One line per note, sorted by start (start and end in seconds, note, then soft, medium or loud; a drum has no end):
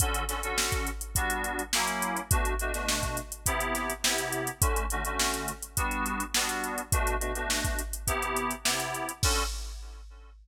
0.00 0.23 D3 loud
0.00 0.23 C#4 medium
0.00 0.23 F#4 medium
0.00 0.23 A4 loud
0.00 kick loud
0.00 closed hi-hat loud
0.14 closed hi-hat medium
0.28 0.40 D3 medium
0.28 0.40 C#4 medium
0.28 0.40 F#4 medium
0.28 0.40 A4 medium
0.28 snare soft
0.28 closed hi-hat medium
0.43 0.89 D3 medium
0.43 0.89 C#4 medium
0.43 0.89 F#4 medium
0.43 0.89 A4 medium
0.43 closed hi-hat medium
0.58 snare loud
0.72 kick medium
0.72 closed hi-hat medium
0.87 closed hi-hat medium
1.01 closed hi-hat medium
1.15 1.62 G3 medium
1.15 1.62 B3 medium
1.15 1.62 D4 medium
1.15 1.62 F#4 loud
1.15 kick medium
1.15 closed hi-hat loud
1.30 closed hi-hat medium
1.44 closed hi-hat medium
1.59 closed hi-hat medium
1.73 2.20 F#3 medium
1.73 2.20 A#3 loud
1.73 2.20 C#4 medium
1.73 2.20 E4 loud
1.73 snare loud
1.87 closed hi-hat medium
2.02 closed hi-hat medium
2.16 closed hi-hat medium
2.31 2.54 B2 loud
2.31 2.54 A3 loud
2.31 2.54 D4 medium
2.31 2.54 F#4 loud
2.31 kick loud
2.31 closed hi-hat loud
2.45 closed hi-hat medium
2.59 2.72 B2 medium
2.59 2.72 A3 medium
2.59 2.72 D4 medium
2.59 2.72 F#4 medium
2.59 closed hi-hat medium
2.73 3.19 B2 medium
2.73 3.19 A3 medium
2.73 3.19 D4 medium
2.73 3.19 F#4 medium
2.73 snare soft
2.73 closed hi-hat medium
2.88 snare loud
3.03 kick medium
3.03 closed hi-hat medium
3.17 closed hi-hat medium
3.32 closed hi-hat medium
3.46 3.92 C3 loud
3.46 3.92 B3 loud
3.46 3.92 E4 loud
3.46 3.92 G4 loud
3.46 kick medium
3.46 closed hi-hat loud
3.60 closed hi-hat medium
3.75 snare soft
3.75 closed hi-hat medium
3.90 closed hi-hat medium
4.03 4.50 C3 medium
4.03 4.50 B3 medium
4.03 4.50 E4 medium
4.03 4.50 G4 medium
4.03 snare loud
4.18 closed hi-hat medium
4.32 closed hi-hat medium
4.47 closed hi-hat medium
4.61 4.84 D3 loud
4.61 4.84 A3 medium
4.61 4.84 C#4 medium
4.61 4.84 F#4 medium
4.61 kick loud
4.61 closed hi-hat loud
4.76 closed hi-hat medium
4.90 5.03 D3 medium
4.90 5.03 A3 medium
4.90 5.03 C#4 medium
4.90 5.03 F#4 medium
4.90 closed hi-hat medium
5.05 5.51 D3 medium
5.05 5.51 A3 medium
5.05 5.51 C#4 medium
5.05 5.51 F#4 medium
5.05 closed hi-hat medium
5.19 snare loud
5.34 snare soft
5.34 closed hi-hat medium
5.48 closed hi-hat medium
5.62 closed hi-hat medium
5.77 6.23 G3 loud
5.77 6.23 B3 medium
5.77 6.23 D4 loud
5.77 6.23 F#4 loud
5.77 kick medium
5.77 closed hi-hat loud
5.91 closed hi-hat medium
6.06 closed hi-hat medium
6.20 closed hi-hat medium
6.34 6.81 G3 medium
6.34 6.81 B3 loud
6.34 6.81 D4 medium
6.34 6.81 F#4 medium
6.34 snare loud
6.49 closed hi-hat medium
6.64 closed hi-hat medium
6.78 closed hi-hat medium
6.92 7.15 B2 loud
6.92 7.15 A3 loud
6.92 7.15 D4 loud
6.92 7.15 F#4 medium
6.92 kick loud
6.92 closed hi-hat loud
7.07 closed hi-hat medium
7.20 7.32 B2 medium
7.20 7.32 A3 medium
7.20 7.32 D4 medium
7.20 7.32 F#4 medium
7.20 closed hi-hat medium
7.35 7.81 B2 medium
7.35 7.81 A3 medium
7.35 7.81 D4 medium
7.35 7.81 F#4 medium
7.35 closed hi-hat medium
7.50 snare loud
7.64 kick medium
7.64 closed hi-hat medium
7.79 closed hi-hat medium
7.93 closed hi-hat medium
8.07 8.53 C3 medium
8.07 8.53 B3 loud
8.07 8.53 E4 loud
8.07 8.53 G4 loud
8.07 kick medium
8.07 closed hi-hat loud
8.22 closed hi-hat medium
8.36 closed hi-hat medium
8.51 closed hi-hat medium
8.65 9.11 C3 medium
8.65 9.11 B3 medium
8.65 9.11 E4 medium
8.65 9.11 G4 medium
8.65 snare loud
8.80 snare soft
8.80 closed hi-hat medium
8.94 closed hi-hat medium
9.09 closed hi-hat medium
9.23 9.43 D3 loud
9.23 9.43 C#4 loud
9.23 9.43 F#4 loud
9.23 9.43 A4 loud
9.23 kick loud
9.23 crash loud